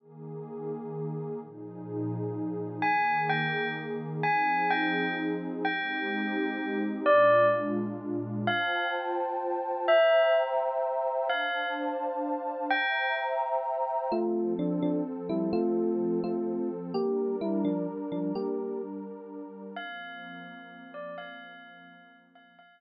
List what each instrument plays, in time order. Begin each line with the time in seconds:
0.00 pad 2 (warm) D#3 A#3 G#4
1.41 pad 2 (warm) A#2 F3 D#4 G#4
2.82 pad 2 (warm) D#3 A#3 G#4, tubular bells G#5
3.29 tubular bells G5
4.23 pad 2 (warm) F3 C4 D#4 G#4, tubular bells G#5
4.70 tubular bells G5
5.65 pad 2 (warm) G#3 C4 D#4 G4, tubular bells G5
7.06 pad 2 (warm) A#2 G#3 D4 F4, tubular bells D5
8.47 pad 2 (warm) F4 C5 G5 A5, tubular bells F5
9.88 pad 2 (warm) C5 E5 G5 A#5, tubular bells E5
11.29 pad 2 (warm) D4 C5 F5 A5, tubular bells F5
12.70 pad 2 (warm) C5 E5 G5 A#5, tubular bells G5
14.12 pad 2 (warm) F3 C4 A4, electric piano 1 A3 F4
14.59 electric piano 1 F3 D4
14.82 electric piano 1 F3 D4
15.29 electric piano 1 G3 E4
15.53 electric piano 1 A3 F4
16.24 electric piano 1 A3 F4
16.94 pad 2 (warm) G3 D4 A#4, electric piano 1 A#3 G4
17.41 electric piano 1 G3 E4
17.65 electric piano 1 F3 D4
18.12 electric piano 1 F3 D4
18.35 electric piano 1 A#3 G4
19.76 pad 2 (warm) F3 A#3 C4, tubular bells F5
20.94 tubular bells D5
21.18 tubular bells F5
22.35 tubular bells F5
22.59 pad 2 (warm) F3 A#3 C4, tubular bells F5